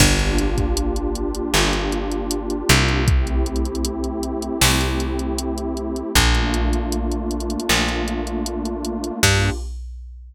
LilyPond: <<
  \new Staff \with { instrumentName = "Pad 2 (warm)" } { \time 4/4 \key g \dorian \tempo 4 = 78 <bes d' f' g'>1 | <a c' e' g'>1 | <a bes d' f'>1 | <bes d' f' g'>4 r2. | }
  \new Staff \with { instrumentName = "Electric Bass (finger)" } { \clef bass \time 4/4 \key g \dorian g,,2 g,,4. c,8~ | c,2 c,2 | bes,,2 bes,,2 | g,4 r2. | }
  \new DrumStaff \with { instrumentName = "Drums" } \drummode { \time 4/4 <cymc bd>16 hh16 hh16 <hh bd>16 hh16 hh16 hh16 hh16 hc16 hh16 hh16 hh16 hh16 hh16 hh16 hh16 | <hh bd>16 hh16 hh32 hh32 hh32 hh32 hh16 hh16 hh16 hh16 sn16 hh16 hh16 hh16 hh16 hh16 hh16 hh16 | <hh bd>16 hh16 hh16 hh16 hh16 hh16 hh32 hh32 hh32 hh32 hc16 hh16 hh16 hh16 hh16 hh16 hh16 hh16 | <cymc bd>4 r4 r4 r4 | }
>>